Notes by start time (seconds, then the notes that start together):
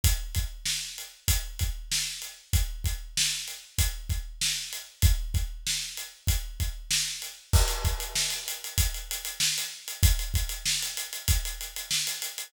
0.04 kick, closed hi-hat
0.35 kick, closed hi-hat
0.65 snare
0.98 closed hi-hat
1.28 kick, closed hi-hat
1.59 kick, closed hi-hat
1.92 snare
2.22 closed hi-hat
2.53 kick, closed hi-hat
2.84 kick, closed hi-hat
3.17 snare
3.48 closed hi-hat
3.78 kick, closed hi-hat
4.10 kick, closed hi-hat
4.41 snare
4.73 closed hi-hat
5.02 kick, closed hi-hat
5.34 kick, closed hi-hat
5.67 snare
5.97 closed hi-hat
6.27 kick, closed hi-hat
6.60 kick, closed hi-hat
6.91 snare
7.22 closed hi-hat
7.53 kick, crash
7.68 closed hi-hat
7.85 kick, closed hi-hat
8.00 closed hi-hat
8.15 snare
8.30 closed hi-hat
8.48 closed hi-hat
8.64 closed hi-hat
8.78 kick, closed hi-hat
8.94 closed hi-hat
9.11 closed hi-hat
9.25 closed hi-hat
9.40 snare
9.58 closed hi-hat
9.88 closed hi-hat
10.03 kick, closed hi-hat
10.19 closed hi-hat
10.34 kick, closed hi-hat
10.49 closed hi-hat
10.65 snare
10.82 closed hi-hat
10.97 closed hi-hat
11.13 closed hi-hat
11.28 kick, closed hi-hat
11.45 closed hi-hat
11.61 closed hi-hat
11.76 closed hi-hat
11.91 snare
12.07 closed hi-hat
12.22 closed hi-hat
12.38 closed hi-hat